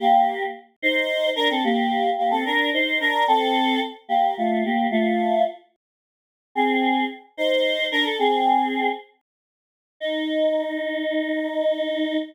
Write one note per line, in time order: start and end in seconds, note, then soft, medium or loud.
0.00 0.43 A#3 loud
0.00 0.43 G4 loud
0.82 1.30 D#4 medium
0.82 1.30 C5 loud
1.36 1.49 D4 medium
1.36 1.49 A#4 loud
1.50 1.63 C4 medium
1.50 1.63 A4 medium
1.64 2.10 A#3 loud
1.64 2.10 G4 loud
2.18 2.31 A#3 medium
2.18 2.31 G4 loud
2.31 2.44 C4 medium
2.31 2.44 A4 loud
2.45 2.70 D4 medium
2.45 2.70 A#4 medium
2.73 2.99 D#4 medium
2.73 2.99 C5 medium
3.00 3.25 D4 medium
3.00 3.25 A#4 loud
3.28 3.80 C4 loud
3.28 3.80 A4 loud
4.09 4.35 A#3 medium
4.09 4.35 G4 loud
4.38 4.63 A3 medium
4.38 4.63 F4 medium
4.65 4.87 A#3 medium
4.65 4.87 G4 medium
4.91 5.43 A3 loud
4.91 5.43 F4 loud
6.55 7.04 C4 loud
6.55 7.04 G#4 loud
7.37 7.86 D#4 medium
7.37 7.86 C5 medium
7.91 8.04 D4 medium
7.91 8.04 A#4 loud
8.04 8.17 A4 medium
8.19 8.88 C4 loud
8.19 8.88 G#4 loud
10.00 12.18 D#4 loud